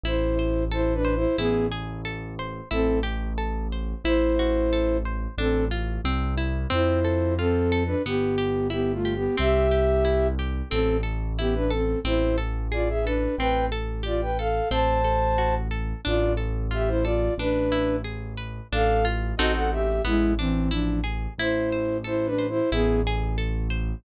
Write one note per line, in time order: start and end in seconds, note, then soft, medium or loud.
0.04 1.26 A1 loud
0.04 0.35 E4 loud
0.04 0.64 E4 medium
0.04 0.64 C5 medium
0.39 0.69 C5 medium
0.72 0.94 E4 medium
0.72 1.02 A4 medium
0.72 0.94 C5 medium
0.94 1.15 D4 medium
0.94 1.15 B4 medium
1.05 1.35 C5 medium
1.15 1.37 E4 medium
1.15 1.37 C5 medium
1.38 2.61 A1 loud
1.38 1.67 B3 medium
1.38 1.68 E4 loud
1.38 1.67 G#4 medium
1.72 2.02 G#4 medium
2.05 2.35 A4 medium
2.39 2.69 C5 medium
2.71 3.94 A1 loud
2.71 2.99 C4 medium
2.71 3.01 E4 loud
2.71 2.99 A4 medium
3.03 3.33 G4 medium
3.38 3.68 A4 medium
3.72 4.02 C5 medium
4.04 5.27 A1 loud
4.04 4.97 E4 medium
4.04 4.35 E4 loud
4.04 4.97 C5 medium
4.39 4.69 F#4 medium
4.73 5.03 A4 medium
5.05 5.35 C5 medium
5.38 5.99 A1 loud
5.38 5.65 C4 medium
5.38 5.68 D4 loud
5.38 5.65 A4 medium
5.71 6.01 F4 medium
6.05 6.66 C2 loud
6.05 6.35 C4 loud
6.38 6.68 E4 medium
6.70 7.95 F2 loud
6.70 7.00 C4 loud
6.70 7.34 E4 medium
6.70 7.34 C5 medium
7.05 7.35 A4 medium
7.38 7.83 C4 medium
7.38 7.69 F4 medium
7.38 7.83 A4 medium
7.72 8.02 A4 medium
7.87 8.02 D4 medium
7.87 8.02 B4 medium
8.06 9.28 G1 loud
8.06 8.36 B3 loud
8.06 8.68 B3 medium
8.06 8.68 G4 medium
8.38 8.68 G4 medium
8.70 8.92 B3 medium
8.70 9.00 E4 medium
8.70 8.92 G4 medium
8.93 9.14 A3 medium
8.93 9.14 F4 medium
9.05 9.35 G4 medium
9.15 9.36 B3 medium
9.15 9.36 G4 medium
9.38 10.62 C2 loud
9.38 9.68 C4 loud
9.38 10.28 G4 medium
9.38 10.28 E5 loud
9.71 10.01 G4 medium
10.05 10.35 E4 medium
10.39 10.69 G4 medium
10.70 11.95 A1 loud
10.70 10.97 C4 medium
10.70 11.01 C4 loud
10.70 10.97 A4 medium
11.03 11.33 A4 medium
11.39 11.55 B3 medium
11.39 11.69 E4 medium
11.39 11.55 G4 medium
11.55 11.71 D4 medium
11.55 11.71 B4 medium
11.71 11.99 C4 medium
11.71 12.01 A4 medium
11.71 11.99 A4 medium
12.05 13.27 A1 loud
12.05 12.35 C4 loud
12.05 12.36 E4 medium
12.05 12.36 C5 medium
12.38 12.68 A4 medium
12.72 12.88 F4 medium
12.72 13.02 G#4 medium
12.72 12.88 D5 medium
12.89 13.05 G#4 medium
12.89 13.05 E5 medium
13.04 13.35 D4 medium
13.04 13.37 A4 medium
13.04 13.35 B4 medium
13.38 14.61 A1 medium
13.38 13.70 C4 loud
13.38 13.66 B4 medium
13.38 13.66 G5 medium
13.72 14.02 A4 medium
14.03 14.21 F4 medium
14.03 14.33 G4 medium
14.03 14.21 D5 medium
14.22 14.38 B4 medium
14.22 14.38 G5 medium
14.39 14.69 A4 medium
14.39 14.69 F5 medium
14.71 15.94 A1 loud
14.71 15.01 C4 loud
14.71 15.55 C5 medium
14.71 15.55 A5 medium
15.04 15.34 A4 medium
15.38 15.68 F#4 medium
15.71 16.01 A4 medium
16.05 17.29 A1 loud
16.05 16.35 D4 medium
16.05 16.33 F4 medium
16.05 16.33 D5 medium
16.37 16.67 A4 medium
16.71 17.01 F4 medium
16.71 16.89 G4 medium
16.71 16.89 E5 medium
16.88 17.04 E4 medium
16.88 17.04 C5 medium
17.03 17.34 F4 medium
17.03 17.35 A4 medium
17.03 17.34 D5 medium
17.38 18.61 A1 loud
17.38 17.96 D4 medium
17.38 17.69 D4 medium
17.38 17.96 B4 medium
17.72 18.02 E4 medium
18.04 18.34 G#4 medium
18.38 18.68 B4 medium
18.72 19.34 A1 loud
18.72 19.03 D4 loud
18.72 19.05 A4 medium
18.72 19.05 F5 medium
19.05 19.35 F4 medium
19.37 20.00 A1 loud
19.37 19.99 C4 loud
19.37 19.99 D#4 loud
19.37 19.53 F#4 medium
19.37 19.99 F#4 loud
19.37 19.99 A4 loud
19.37 19.53 D#5 medium
19.55 19.71 A4 medium
19.55 19.71 F#5 medium
19.72 20.02 G4 medium
19.72 20.02 E5 medium
20.05 21.27 A1 loud
20.05 20.33 G#3 medium
20.05 20.35 B3 loud
20.05 20.33 E4 medium
20.39 20.70 E3 medium
20.39 20.70 C4 medium
20.39 20.69 D4 medium
20.71 21.00 F3 medium
20.71 21.00 D4 medium
20.71 21.01 E4 medium
21.04 21.34 G#4 medium
21.38 22.61 A1 loud
21.38 21.98 E4 medium
21.38 21.70 E4 loud
21.38 21.98 C5 medium
21.73 22.03 C5 medium
22.04 22.27 E4 medium
22.04 22.34 A4 medium
22.04 22.27 C5 medium
22.26 22.47 D4 medium
22.26 22.47 B4 medium
22.38 22.68 C5 medium
22.49 22.70 E4 medium
22.49 22.70 C5 medium
22.72 23.95 A1 loud
22.72 23.01 B3 medium
22.72 23.02 E4 loud
22.72 23.01 G#4 medium
23.07 23.37 G#4 medium
23.38 23.68 A4 medium
23.70 24.00 C5 medium